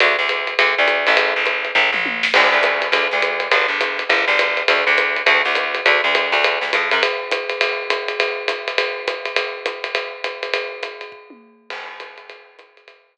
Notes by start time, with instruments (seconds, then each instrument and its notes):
0.00 electric bass (finger) D2, ride
0.19 electric bass (finger) D2
0.29 hi-hat pedal, ride
0.47 ride
0.59 electric bass (finger) D2, ride
0.78 electric bass (finger) D2
0.88 hi-hat pedal, ride
1.07 electric bass (finger) A1, ride
1.17 kick, ride
1.36 electric bass (finger) A1
1.46 hi-hat pedal, ride
1.65 ride
1.75 electric bass (finger) A1, kick, floor tom
1.92 electric bass (finger) A1, mid tom
2.06 high tom
2.23 snare
2.34 electric bass (finger) D2, crash, ride
2.52 electric bass (finger) D2
2.63 hi-hat pedal, ride
2.82 ride
2.92 electric bass (finger) D2, ride
3.11 electric bass (finger) D2, snare
3.22 hi-hat pedal, ride
3.40 ride
3.51 electric bass (finger) G1, ride
3.68 electric bass (finger) G1
3.81 hi-hat pedal, ride
3.99 ride
4.09 electric bass (finger) G1, kick, ride
4.28 electric bass (finger) G1, snare
4.39 hi-hat pedal, ride
4.57 ride
4.68 electric bass (finger) D2, ride
4.87 electric bass (finger) D2
4.98 kick, hi-hat pedal, ride
5.16 ride
5.26 electric bass (finger) D2, kick, ride
5.45 electric bass (finger) D2, snare
5.55 hi-hat pedal, ride
5.75 ride
5.86 electric bass (finger) D2, ride
6.04 electric bass (finger) D2
6.15 hi-hat pedal, ride
6.32 electric bass (finger) D2, ride
6.44 kick, ride
6.61 electric bass (finger) D2, snare
6.73 electric bass (finger) F2, kick, hi-hat pedal, ride
6.91 electric bass (finger) F#2, ride
7.03 ride
7.31 hi-hat pedal, ride
7.50 ride
7.61 ride
7.90 hi-hat pedal, ride
8.08 ride
8.20 kick, ride
8.48 hi-hat pedal, ride
8.68 ride
8.78 kick, ride
9.08 hi-hat pedal, ride
9.25 ride
9.36 ride
9.66 hi-hat pedal, ride
9.84 ride
9.95 ride
10.24 hi-hat pedal, ride
10.43 ride
10.54 ride
10.83 hi-hat pedal, ride
11.01 ride
11.12 kick
11.30 high tom
11.70 crash, ride
12.00 hi-hat pedal, ride
12.18 ride
12.30 kick, ride
12.59 hi-hat pedal, ride
12.77 ride
12.88 ride
13.17 hi-hat pedal